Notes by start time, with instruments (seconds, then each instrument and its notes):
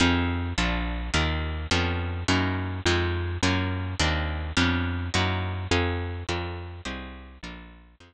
0.00 electric bass (finger) F2, acoustic guitar (steel) C4 D#4 F4 G#4
0.58 electric bass (finger) A#1, acoustic guitar (steel) A#3 D4 F4 A4
1.14 electric bass (finger) D#2, acoustic guitar (steel) A#3 D#4 F4 G4
1.71 electric bass (finger) F2, acoustic guitar (steel) B3 C#4 D4 F4
2.28 electric bass (finger) F#2, acoustic guitar (steel) A#3 D#4 E4 F#4
2.85 electric bass (finger) F2, acoustic guitar (steel) G#3 C4 D#4 F4
3.43 electric bass (finger) F#2, acoustic guitar (steel) A#3 C#4 F4 F#4
4.00 electric bass (finger) D#2, acoustic guitar (steel) A#3 C4 D4 D#4
4.57 electric bass (finger) F2, acoustic guitar (steel) B3 C#4 D4 F4
5.14 electric bass (finger) F#2, acoustic guitar (steel) A#3 D#4 E4 F#4
5.71 electric bass (finger) F2, acoustic guitar (steel) G#4 C5 D#5 F5
6.29 electric bass (finger) F2, acoustic guitar (steel) A4 A#4 D5 F5
6.85 electric bass (finger) C2, acoustic guitar (steel) G4 G#4 C5 D#5
7.43 electric bass (finger) A#1, acoustic guitar (steel) F4 A4 A#4 D5
8.00 electric bass (finger) F2, acoustic guitar (steel) F4 G#4 C5 D#5